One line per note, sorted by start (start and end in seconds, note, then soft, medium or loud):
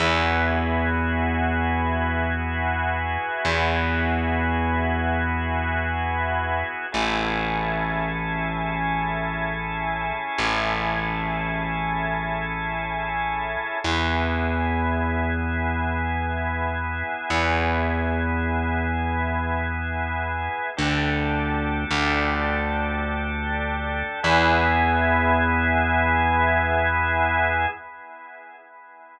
0.00 3.18 E2 loud
0.00 6.85 B3 medium
0.00 6.85 E4 medium
0.00 6.85 F#4 medium
0.00 6.85 G#4 medium
3.45 6.63 E2 medium
6.92 10.12 A1 loud
6.92 13.78 C#4 medium
6.92 13.78 E4 medium
6.92 13.78 G#4 medium
6.92 13.78 A4 medium
10.38 13.57 A1 medium
13.84 17.03 E2 loud
13.84 20.70 B3 medium
13.84 20.70 E4 medium
13.84 20.70 G#4 medium
17.30 20.49 E2 medium
20.77 21.85 D2 loud
20.77 24.20 D4 medium
20.77 24.20 G4 medium
20.77 24.20 A4 medium
21.91 24.03 D2 medium
24.23 27.67 E2 loud
24.23 27.66 B3 loud
24.23 27.66 E4 loud
24.23 27.66 G#4 loud